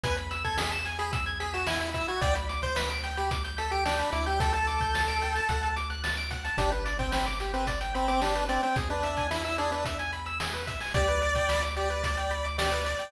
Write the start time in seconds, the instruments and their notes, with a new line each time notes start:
0.04 synth bass 1 E2, lead 1 (square) B4 G#5, kick, closed hi-hat
0.17 lead 1 (square) B5, closed hi-hat
0.31 lead 1 (square) E6, closed hi-hat
0.44 lead 1 (square) A4 G#6, kick, closed hi-hat
0.58 lead 1 (square) G#4 B6, snare
0.72 lead 1 (square) E7, closed hi-hat
0.85 lead 1 (square) G#5, closed hi-hat
0.99 lead 1 (square) G#4 B5, closed hi-hat
1.13 lead 1 (square) E6, kick, closed hi-hat
1.26 lead 1 (square) G#6, closed hi-hat
1.40 lead 1 (square) G#4 B6, closed hi-hat
1.54 lead 1 (square) F#4 E7, closed hi-hat
1.67 lead 1 (square) E4 G#5, snare
1.80 lead 1 (square) B5, closed hi-hat
1.94 lead 1 (square) E4 E6, kick, closed hi-hat
2.08 lead 1 (square) F#4 G#6, closed hi-hat
2.21 synth bass 1 D2, lead 1 (square) D5 G5, kick, closed hi-hat
2.35 lead 1 (square) B5, closed hi-hat
2.49 lead 1 (square) D6, closed hi-hat
2.62 lead 1 (square) C5 G6, kick, closed hi-hat
2.76 lead 1 (square) B4 B6, snare
2.90 lead 1 (square) D7, closed hi-hat
3.04 lead 1 (square) G5, closed hi-hat
3.17 lead 1 (square) G4 B5, closed hi-hat
3.31 lead 1 (square) D6, kick, closed hi-hat
3.45 lead 1 (square) G6, closed hi-hat
3.58 lead 1 (square) A4 B6, closed hi-hat
3.71 lead 1 (square) G4 D7, closed hi-hat
3.86 lead 1 (square) D4 G5, snare
3.99 lead 1 (square) B5, closed hi-hat
4.13 synth bass 1 D2, lead 1 (square) E4 D6, closed hi-hat
4.26 lead 1 (square) G4 G6, closed hi-hat
4.40 lead 1 (square) A4 G5, kick, closed hi-hat
4.53 lead 1 (square) A4 A5, closed hi-hat
4.67 lead 1 (square) D6, closed hi-hat
4.81 lead 1 (square) G6, kick, closed hi-hat
4.95 lead 1 (square) A6, snare
5.08 lead 1 (square) D7, closed hi-hat
5.22 lead 1 (square) G5, closed hi-hat
5.35 lead 1 (square) A5, closed hi-hat
5.49 synth bass 1 D2, lead 1 (square) F#5, kick, closed hi-hat
5.63 lead 1 (square) A5, closed hi-hat
5.76 lead 1 (square) D6, closed hi-hat
5.90 lead 1 (square) F#6, closed hi-hat
6.04 lead 1 (square) A6, snare
6.17 lead 1 (square) D7, closed hi-hat
6.31 lead 1 (square) F#5, kick, closed hi-hat
6.45 lead 1 (square) A5, closed hi-hat
6.58 synth bass 1 G1, lead 1 (square) D4 G4, kick, closed hi-hat
6.72 lead 1 (square) B4, closed hi-hat
6.85 lead 1 (square) D5, closed hi-hat
6.99 lead 1 (square) C4 G5, kick, closed hi-hat
7.12 lead 1 (square) C4 B5, snare
7.26 lead 1 (square) D6, closed hi-hat
7.40 lead 1 (square) G4, closed hi-hat
7.54 lead 1 (square) C4 B4, closed hi-hat
7.67 lead 1 (square) D5, kick, closed hi-hat
7.81 lead 1 (square) G5, closed hi-hat
7.95 lead 1 (square) C4 B5, closed hi-hat
8.08 lead 1 (square) C4 D6, closed hi-hat
8.22 lead 1 (square) D4 G4, snare
8.35 lead 1 (square) B4, closed hi-hat
8.49 lead 1 (square) C4 D5, closed hi-hat
8.63 lead 1 (square) C4 G5, closed hi-hat
8.76 synth bass 1 E2, lead 1 (square) G#4, kick, closed hi-hat
8.90 lead 1 (square) D4 B4, closed hi-hat
9.03 lead 1 (square) E5, closed hi-hat
9.17 lead 1 (square) G#5, kick, closed hi-hat
9.31 lead 1 (square) E4 B5, snare
9.45 lead 1 (square) E4 E6, closed hi-hat
9.58 lead 1 (square) D4 G#4, closed hi-hat
9.72 lead 1 (square) D4 B4, closed hi-hat
9.85 lead 1 (square) E5, kick, closed hi-hat
9.99 lead 1 (square) G#5, closed hi-hat
10.13 lead 1 (square) B5, closed hi-hat
10.26 lead 1 (square) E6, closed hi-hat
10.40 lead 1 (square) G#4, snare
10.54 lead 1 (square) B4, closed hi-hat
10.67 lead 1 (square) E5, kick, closed hi-hat
10.80 lead 1 (square) G#5, open hi-hat
10.94 synth bass 1 D2, lead 1 (square) G4 D5, kick, closed hi-hat
11.08 lead 1 (square) B4, closed hi-hat
11.22 lead 1 (square) D5, closed hi-hat
11.35 lead 1 (square) G5, kick, closed hi-hat
11.49 lead 1 (square) B5, snare
11.63 lead 1 (square) D6, closed hi-hat
11.76 lead 1 (square) G4 D5, closed hi-hat
11.90 lead 1 (square) B4, closed hi-hat
12.04 lead 1 (square) D5, kick, closed hi-hat
12.17 lead 1 (square) G5, closed hi-hat
12.31 lead 1 (square) B5, closed hi-hat
12.45 lead 1 (square) D6, closed hi-hat
12.58 lead 1 (square) G4 D5, snare
12.71 lead 1 (square) B4, closed hi-hat
12.85 lead 1 (square) D5, closed hi-hat
12.99 lead 1 (square) G5, closed hi-hat